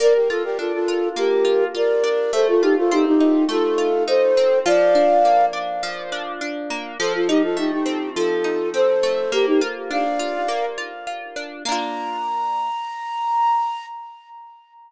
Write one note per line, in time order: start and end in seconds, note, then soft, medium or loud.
0.00 1.16 A#3 loud
0.00 0.13 A#4 loud
0.00 0.13 D5 loud
0.14 0.28 G4 medium
0.14 0.28 A#4 medium
0.29 0.43 F4 medium
0.29 0.88 F4 medium
0.29 0.43 A4 loud
0.44 0.58 G4 loud
0.44 0.58 A#4 loud
0.58 2.03 D4 medium
0.58 0.72 F4 medium
0.58 0.72 A4 medium
0.73 1.09 F4 medium
0.73 1.09 A4 loud
0.88 1.44 F4 medium
1.16 2.27 A#3 medium
1.16 1.64 G4 medium
1.16 1.64 A#4 medium
1.45 1.74 F4 medium
1.75 2.30 F4 medium
1.75 2.32 A#4 medium
1.75 2.32 D5 loud
2.04 2.31 D4 medium
2.33 3.48 A3 loud
2.33 2.47 A4 medium
2.33 2.47 C5 loud
2.48 2.62 F4 medium
2.48 2.62 A4 loud
2.62 2.76 D#4 medium
2.62 3.78 F4 medium
2.62 2.76 G4 loud
2.77 2.91 F4 medium
2.77 2.91 A4 loud
2.91 4.37 C4 medium
2.91 3.05 D#4 medium
2.91 3.05 G4 loud
3.06 3.45 D#4 loud
3.06 3.45 G4 loud
3.21 4.07 D#4 medium
3.49 4.59 A3 medium
3.49 4.03 F4 loud
3.49 4.03 A4 loud
3.78 4.61 F4 medium
4.07 4.63 D#4 medium
4.07 4.59 A4 medium
4.07 4.59 C5 loud
4.37 4.65 C4 medium
4.66 5.82 F3 loud
4.66 5.46 D5 loud
4.66 5.46 F5 loud
4.95 5.53 D4 medium
5.25 6.70 A#3 medium
5.53 6.12 D4 medium
5.83 6.94 F3 medium
6.12 6.41 D4 medium
6.41 6.96 D4 medium
6.70 6.98 A#3 medium
6.99 8.16 F3 loud
6.99 7.13 A4 loud
6.99 7.13 C5 loud
7.14 7.28 F4 medium
7.14 7.28 A4 medium
7.28 7.42 D#4 medium
7.28 8.44 D#4 medium
7.28 7.42 G4 loud
7.43 7.57 F4 medium
7.43 7.57 A4 loud
7.57 9.03 A3 medium
7.57 7.71 D#4 medium
7.57 7.71 G4 medium
7.71 8.10 D#4 medium
7.71 8.10 G4 medium
7.86 8.73 C4 medium
8.16 9.27 F3 medium
8.16 8.69 F4 medium
8.16 8.69 A4 loud
8.44 9.27 D#4 medium
8.74 9.29 C4 medium
8.74 9.31 A4 medium
8.74 9.31 C5 loud
9.03 9.31 A3 medium
9.32 10.48 A#3 loud
9.32 9.46 G4 loud
9.32 9.46 A#4 loud
9.46 9.60 D#4 medium
9.46 9.60 G4 loud
9.61 10.19 F4 medium
9.91 11.36 D4 medium
9.91 10.65 D5 medium
9.91 10.65 F5 loud
10.19 10.77 F4 medium
10.48 11.59 A#3 medium
10.78 11.07 F4 medium
11.07 11.62 F4 medium
11.36 11.64 D4 medium
11.65 13.85 A#3 loud
11.65 13.85 D4 medium
11.65 13.86 A#5 loud
11.72 13.85 F4 loud